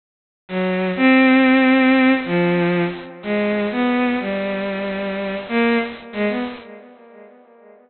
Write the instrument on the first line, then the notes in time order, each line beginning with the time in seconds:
violin
0.48 F#3
0.97 C4
2.25 F3
3.23 G#3
3.71 B3
4.20 G3
5.49 A#3
6.13 G#3
6.29 B3